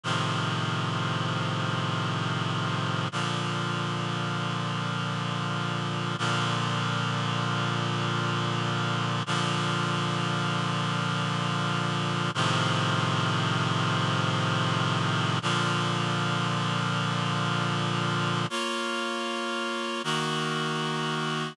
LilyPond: \new Staff { \time 4/4 \key bes \major \tempo 4 = 78 <a, c ees f>1 | <bes, d f>1 | <bes, d f>1 | <bes, d f>1 |
<a, c ees f>1 | <bes, d f>1 | \key bes \minor <bes f' des''>2 <ees bes ges'>2 | }